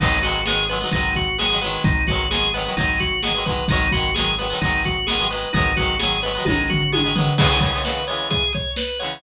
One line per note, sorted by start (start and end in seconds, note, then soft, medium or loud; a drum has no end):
0.00 0.85 G#1 medium
0.00 0.18 F#3 medium
0.00 0.18 G#3 medium
0.00 0.18 B3 medium
0.00 0.21 D#4 medium
0.00 kick medium
0.00 crash medium
0.04 0.18 D#3 medium
0.23 0.41 F#3 medium
0.23 0.41 G#3 medium
0.23 0.41 B3 medium
0.23 0.44 F#4 medium
0.23 closed hi-hat medium
0.27 0.41 D#3 medium
0.46 0.65 F#3 medium
0.46 0.65 G#3 medium
0.46 0.65 B3 medium
0.46 0.67 G#4 medium
0.46 snare medium
0.51 0.65 D#3 medium
0.69 0.79 F#3 medium
0.69 0.79 G#3 medium
0.69 0.79 B3 medium
0.69 0.91 B4 medium
0.69 closed hi-hat medium
0.74 0.79 D#3 medium
0.81 0.90 F#3 medium
0.81 0.90 G#3 medium
0.81 0.90 B3 medium
0.85 0.90 D#3 medium
0.91 1.78 G#1 medium
0.91 1.29 G#3 medium
0.91 1.29 B3 medium
0.91 1.14 D#4 medium
0.91 kick medium
0.91 closed hi-hat medium
0.95 1.29 D#3 medium
0.95 1.29 F#3 medium
1.15 1.37 F#4 medium
1.15 kick medium
1.15 closed hi-hat medium
1.38 1.48 F#3 medium
1.38 1.48 G#3 medium
1.38 1.48 B3 medium
1.38 1.60 G#4 medium
1.38 snare medium
1.43 1.48 D#3 medium
1.50 1.59 F#3 medium
1.50 1.59 G#3 medium
1.50 1.59 B3 medium
1.54 1.59 D#3 medium
1.61 2.03 F#3 medium
1.61 2.03 G#3 medium
1.61 2.03 B3 medium
1.61 1.82 B4 medium
1.61 closed hi-hat medium
1.66 2.03 D#3 medium
1.84 2.70 G#1 medium
1.84 2.06 D#4 medium
1.84 kick loud
1.84 closed hi-hat medium
2.07 2.27 G#3 medium
2.07 2.27 B3 medium
2.07 2.29 F#4 medium
2.07 kick medium
2.07 closed hi-hat soft
2.11 2.27 D#3 medium
2.11 2.27 F#3 medium
2.31 2.49 F#3 medium
2.31 2.49 G#3 medium
2.31 2.49 B3 medium
2.31 2.52 G#4 medium
2.31 snare loud
2.35 2.49 D#3 medium
2.54 2.63 F#3 medium
2.54 2.63 G#3 medium
2.54 2.63 B3 medium
2.54 2.75 B4 medium
2.54 closed hi-hat medium
2.58 2.63 D#3 medium
2.65 2.74 F#3 medium
2.65 2.74 G#3 medium
2.65 2.74 B3 medium
2.70 2.74 D#3 medium
2.77 3.62 G#1 medium
2.77 3.14 F#3 medium
2.77 3.14 G#3 medium
2.77 3.14 B3 medium
2.77 2.98 D#4 medium
2.77 kick medium
2.77 closed hi-hat loud
2.82 3.14 D#3 medium
3.00 3.21 F#4 medium
3.00 kick medium
3.00 closed hi-hat medium
3.23 3.33 F#3 medium
3.23 3.33 G#3 medium
3.23 3.33 B3 medium
3.23 3.44 G#4 medium
3.23 snare medium
3.28 3.33 D#3 medium
3.34 3.44 F#3 medium
3.34 3.44 G#3 medium
3.34 3.44 B3 medium
3.39 3.44 D#3 medium
3.45 3.65 F#3 medium
3.45 3.65 G#3 medium
3.45 3.65 B3 medium
3.45 3.67 B4 medium
3.45 kick medium
3.45 closed hi-hat medium
3.51 3.65 D#3 medium
3.68 4.53 G#1 medium
3.68 3.87 G#3 medium
3.68 3.87 B3 medium
3.68 3.92 D#4 medium
3.68 kick medium
3.68 closed hi-hat loud
3.72 3.87 D#3 medium
3.72 3.87 F#3 medium
3.92 4.11 F#3 medium
3.92 4.11 G#3 medium
3.92 4.11 B3 medium
3.92 4.14 F#4 medium
3.92 kick medium
3.92 closed hi-hat medium
3.97 4.11 D#3 medium
4.14 4.34 G#3 medium
4.14 4.34 B3 medium
4.14 4.36 G#4 medium
4.14 snare medium
4.19 4.34 D#3 medium
4.19 4.34 F#3 medium
4.38 4.48 F#3 medium
4.38 4.48 G#3 medium
4.38 4.48 B3 medium
4.38 4.60 B4 medium
4.38 closed hi-hat medium
4.43 4.48 D#3 medium
4.50 4.59 F#3 medium
4.50 4.59 G#3 medium
4.50 4.59 B3 medium
4.55 4.59 D#3 medium
4.61 5.47 G#1 medium
4.61 4.99 F#3 medium
4.61 4.99 G#3 medium
4.61 4.99 B3 medium
4.61 4.83 D#4 medium
4.61 kick medium
4.61 closed hi-hat medium
4.66 4.99 D#3 medium
4.84 5.06 F#4 medium
4.84 kick medium
4.84 closed hi-hat medium
5.07 5.17 G#3 medium
5.07 5.17 B3 medium
5.07 5.28 G#4 medium
5.07 snare loud
5.11 5.17 D#3 medium
5.11 5.17 F#3 medium
5.19 5.28 F#3 medium
5.19 5.28 G#3 medium
5.19 5.28 B3 medium
5.23 5.28 D#3 medium
5.31 5.49 F#3 medium
5.31 5.49 G#3 medium
5.31 5.49 B3 medium
5.31 5.52 B4 medium
5.31 closed hi-hat medium
5.35 5.49 D#3 medium
5.53 6.39 G#1 medium
5.53 5.73 G#3 medium
5.53 5.73 B3 medium
5.53 5.74 D#4 medium
5.53 kick medium
5.53 closed hi-hat medium
5.57 5.73 D#3 medium
5.57 5.73 F#3 medium
5.77 5.96 F#3 medium
5.77 5.96 G#3 medium
5.77 5.96 B3 medium
5.77 5.98 F#4 medium
5.77 kick medium
5.77 closed hi-hat medium
5.82 5.96 D#3 medium
5.99 6.18 F#3 medium
5.99 6.18 G#3 medium
5.99 6.18 B3 medium
5.99 6.20 G#4 medium
5.99 snare medium
6.05 6.18 D#3 medium
6.22 6.32 G#3 medium
6.22 6.32 B3 medium
6.22 6.44 B4 medium
6.22 closed hi-hat medium
6.26 6.32 D#3 medium
6.26 6.32 F#3 medium
6.35 6.44 F#3 medium
6.35 6.44 G#3 medium
6.35 6.44 B3 medium
6.40 6.44 D#3 medium
6.45 7.31 G#1 medium
6.45 6.83 G#3 medium
6.45 6.83 B3 medium
6.45 6.67 D#4 medium
6.45 kick medium
6.45 high tom medium
6.50 6.83 D#3 medium
6.50 6.83 F#3 medium
6.70 6.91 F#4 medium
6.70 floor tom medium
6.92 7.02 F#3 medium
6.92 7.02 G#3 medium
6.92 7.02 B3 medium
6.92 7.14 G#4 medium
6.92 high tom medium
6.97 7.02 D#3 medium
7.04 7.13 F#3 medium
7.04 7.13 G#3 medium
7.04 7.13 B3 medium
7.09 7.13 D#3 medium
7.15 7.34 F#3 medium
7.15 7.34 G#3 medium
7.15 7.34 B3 medium
7.15 7.37 B4 medium
7.15 floor tom medium
7.20 7.34 D#3 medium
7.38 7.48 E3 medium
7.38 7.48 G#3 medium
7.38 7.48 B3 medium
7.38 7.60 G#4 medium
7.38 kick medium
7.38 crash loud
7.43 7.48 C#3 medium
7.50 7.60 E3 medium
7.50 7.60 G#3 medium
7.50 7.60 B3 medium
7.55 7.60 C#3 medium
7.61 7.70 E3 medium
7.61 7.70 G#3 medium
7.61 7.70 B3 medium
7.61 7.83 C#5 medium
7.61 kick medium
7.61 closed hi-hat medium
7.66 7.70 C#3 medium
7.73 7.82 E3 medium
7.73 7.82 G#3 medium
7.73 7.82 B3 medium
7.77 7.82 C#3 medium
7.85 8.03 E3 medium
7.85 8.03 G#3 medium
7.85 8.03 B3 medium
7.85 8.06 B4 medium
7.85 snare medium
7.89 8.03 C#3 medium
8.07 8.45 E3 medium
8.07 8.45 G#3 medium
8.07 8.45 B3 medium
8.07 8.29 C#5 medium
8.07 closed hi-hat medium
8.12 8.45 C#3 medium
8.30 8.52 G#4 medium
8.30 kick medium
8.30 closed hi-hat medium
8.53 8.76 C#5 medium
8.53 kick medium
8.53 closed hi-hat medium
8.76 8.98 B4 medium
8.76 snare medium
8.99 9.18 E3 medium
8.99 9.18 G#3 medium
8.99 9.18 B3 medium
8.99 9.20 C#5 medium
8.99 closed hi-hat medium
9.05 9.18 C#3 medium